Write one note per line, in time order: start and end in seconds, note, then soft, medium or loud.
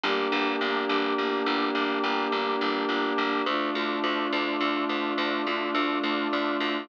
0.03 0.28 G1 loud
0.03 3.44 A#3 loud
0.03 3.44 D4 loud
0.03 3.44 G4 medium
0.32 0.56 G1 loud
0.61 0.85 G1 loud
0.89 1.14 G1 loud
1.18 1.43 G1 medium
1.46 1.71 G1 loud
1.75 1.99 G1 medium
2.03 2.28 G1 loud
2.32 2.56 G1 loud
2.61 2.85 G1 loud
2.89 3.13 G1 medium
3.18 3.42 G1 medium
3.46 3.70 D2 loud
3.46 6.86 A3 loud
3.46 6.86 D4 loud
3.46 6.86 F4 medium
3.75 4.00 D2 medium
4.04 4.28 D2 medium
4.33 4.57 D2 loud
4.60 4.85 D2 loud
4.89 5.14 D2 medium
5.18 5.42 D2 loud
5.47 5.71 D2 medium
5.75 5.99 D2 loud
6.03 6.28 D2 loud
6.33 6.57 D2 loud
6.60 6.85 D2 loud